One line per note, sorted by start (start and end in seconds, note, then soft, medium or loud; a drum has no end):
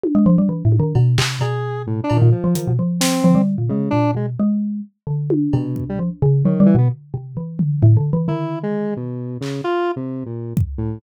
0.04 high tom loud
0.15 0.25 G#3 loud
0.26 0.36 F3 loud
0.38 0.49 G3 medium
0.49 0.63 E3 medium
0.65 0.79 A2 medium
0.72 high tom medium
0.79 0.93 D#3 loud
0.95 1.16 B2 loud
0.95 cowbell medium
1.18 1.39 C3 loud
1.18 clap loud
1.41 2.03 B2 medium
1.41 1.82 G#4 medium
1.41 cowbell medium
1.87 2.01 A2 medium
2.04 2.17 D4 medium
2.10 2.21 A#2 medium
2.10 cowbell medium
2.16 2.30 D#3 medium
2.22 2.32 A#2 loud
2.32 2.73 F3 medium
2.44 2.54 F3 medium
2.55 2.66 D#3 medium
2.55 closed hi-hat medium
2.68 2.78 B2 medium
2.79 3.20 F3 medium
3.00 3.42 C4 medium
3.00 snare loud
3.24 3.35 F3 loud
3.24 floor tom medium
3.35 3.56 G3 medium
3.58 3.69 A#2 medium
3.69 3.90 C#3 medium
3.69 3.91 G#3 medium
3.90 4.13 A#2 medium
3.90 4.11 D4 loud
4.15 4.35 B2 soft
4.15 4.26 G#3 medium
4.40 4.81 G#3 medium
5.07 5.48 D3 medium
5.30 high tom loud
5.53 5.85 B2 medium
5.53 5.95 C3 loud
5.53 cowbell medium
5.76 kick medium
5.89 6.00 G3 medium
5.99 6.10 F3 medium
6.22 6.43 C#3 loud
6.45 6.66 D#3 medium
6.45 6.59 F#3 medium
6.45 floor tom medium
6.60 6.74 G3 loud
6.66 6.76 E3 loud
6.75 6.89 B2 loud
6.75 6.88 B3 medium
7.14 7.34 C3 medium
7.37 7.78 E3 medium
7.59 floor tom loud
7.82 7.96 A2 loud
7.82 floor tom medium
7.97 8.11 D3 medium
8.13 8.27 E3 medium
8.28 9.10 D#3 medium
8.28 8.59 E4 medium
8.28 floor tom medium
8.63 8.94 G#3 medium
8.97 9.38 B2 medium
9.41 9.61 C#3 medium
9.41 clap medium
9.64 9.92 F4 loud
9.96 10.24 C3 medium
10.26 10.54 A#2 soft
10.57 kick loud
10.78 10.99 A2 medium